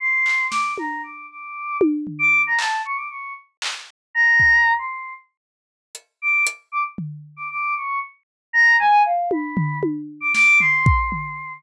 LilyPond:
<<
  \new Staff \with { instrumentName = "Choir Aahs" } { \time 5/8 \tempo 4 = 116 c'''4 d'''8 ais''8 d'''8 | d'''4 r8. d'''8 ais''16 | a''8 cis'''16 d'''16 cis'''8 r4 | r8 ais''4~ ais''16 c'''8. |
r2 d'''8 | r8 d'''16 r4 d'''16 d'''8 | cis'''8 r4 ais''8 gis''8 | f''8 b''4 r8. d'''16 |
d'''8 c'''2 | }
  \new DrumStaff \with { instrumentName = "Drums" } \drummode { \time 5/8 r8 hc8 sn8 tommh4 | r4 tommh8 tomfh4 | hc4. r8 hc8 | r4 bd8 r4 |
r4. hh4 | hh4 tomfh8 r4 | r4. r4 | r8 tommh8 tomfh8 tommh4 |
sn8 tomfh8 bd8 tomfh4 | }
>>